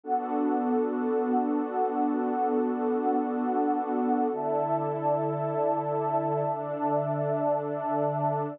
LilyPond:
<<
  \new Staff \with { instrumentName = "Pad 2 (warm)" } { \time 4/4 \key d \major \tempo 4 = 56 <b d' fis' a'>1 | <d e' a'>2 <d d' a'>2 | }
  \new Staff \with { instrumentName = "Pad 2 (warm)" } { \time 4/4 \key d \major <b d' a' fis''>1 | <d'' e'' a''>1 | }
>>